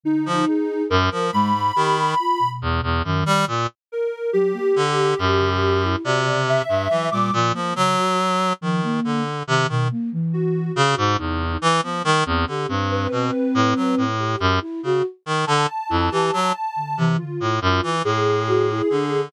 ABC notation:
X:1
M:9/8
L:1/16
Q:3/8=47
K:none
V:1 name="Clarinet" clef=bass
z F, z2 ^F,, =F, ^G,,2 ^D,2 z2 E,, E,, ^F,, =G, ^A,, z | z4 D,2 ^F,,4 C,3 G,, E, ^A,, A,, =F, | ^F,4 ^D,2 =D,2 C, ^D, z4 ^C, ^G,, E,,2 | E, F, ^D, E,, =D, G,,2 B,, z A,, ^F, A,,2 ^F,, z ^C, z ^D, |
D, z F,, E, ^F, z2 C, z A,, ^F,, E, A,,4 D,2 |]
V:2 name="Flute"
D,2 ^G2 z2 ^G, z =G z F B,,3 ^D,2 z2 | z2 ^F, ^A, z3 ^C, z E ^F C,2 z F, G, =F, A, | ^C, ^F z2 =F, ^A,2 z ^D, B,, A, E,3 =C,4 | z B, G, C G C7 G2 E ^F z2 |
z2 E G z2 D, E, D, z5 ^F E D z |]
V:3 name="Ocarina"
^D4 ^A2 b6 z6 | ^A2 G8 d2 e3 d' z2 | z12 ^F2 F2 ^D2 | z6 B6 z6 |
a8 F4 ^G6 |]